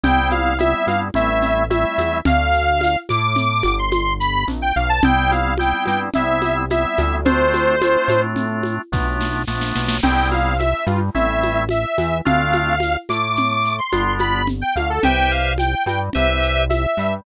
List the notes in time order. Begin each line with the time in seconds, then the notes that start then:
0.03 C2 G3 B3 C4 E4 G5, low conga, shaker
0.30 F5, high conga, shaker
0.58 G3 B3 C4 E4 E5, high conga, shaker
0.87 G2 F5, high conga, shaker
1.14 A1 G3 A3 C4 E4 E5, low conga, shaker
1.42 low conga, shaker
1.70 G3 A3 C4 E4 E5, high conga, shaker
1.98 E2, high conga, shaker
2.25 D2 F5, low conga, shaker
2.53 shaker
2.81 high conga, shaker
3.09 A2 D6, high conga, shaker
3.36 low conga, shaker
3.63 G1, high conga, shaker
3.79 C6
3.92 high conga, shaker
4.20 B5, shaker
4.48 A#1, low conga, shaker
4.62 G5
4.76 B1 F5, shaker
4.89 A5
5.03 C2 G3 B3 C4 E4 G5, low conga, shaker
5.31 F5, high conga, shaker
5.58 G3 B3 C4 E4 G5, high conga, shaker
5.86 G2 G5, high conga, shaker
6.14 C2 G3 B3 C4 E4 E5, low conga, shaker
6.42 high conga, shaker
6.70 G3 B3 C4 E4 E5, high conga, shaker
6.98 D2, high conga, shaker
7.25 A3 C4 D4 F4 C5, low conga, shaker
7.53 high conga, shaker
7.82 A3 C4 D4 F4, high conga, shaker
8.08 A2, high conga, shaker
8.36 low conga, shaker
8.63 high conga, shaker
8.92 B1 A3 B3 D4 F4, kick, snare
9.21 snare
9.47 A#1 A3 B3 D4 F4, snare
9.61 snare
9.75 B1, snare
9.89 snare
10.03 C2 G3 B3 C4 E4 G5, crash, low conga, shaker
10.31 F5, high conga, shaker
10.59 E5, high conga, shaker
10.86 G2 G3 F4, high conga, shaker
11.15 A1 G3 A3 C4 E4 E5, low conga, shaker
11.43 high conga, shaker
11.69 E5, high conga, shaker
11.98 E2 E3, high conga, shaker
12.25 D2 A3 C4 D4 F4 F5, low conga, shaker
12.53 high conga, shaker
12.80 high conga, shaker
13.09 A2 A3 D6, high conga, shaker
13.36 low conga, shaker
13.64 shaker
13.79 C6
13.92 G1 G3 B3 D4 F4, high conga, shaker
14.19 B5, high conga, shaker
14.47 low conga, shaker
14.61 G5
14.76 D2 D3 F5, high conga, shaker
14.90 A4
15.03 C2 G4 B4 C5 E5 G5, low conga, shaker
15.31 F5, shaker
15.58 G5, high conga, shaker
15.86 G2 G3 G5, high conga, shaker
16.13 C2 G4 B4 C5 E5, low conga, shaker
16.42 shaker
16.70 E5, high conga, shaker
16.97 G2 G3, shaker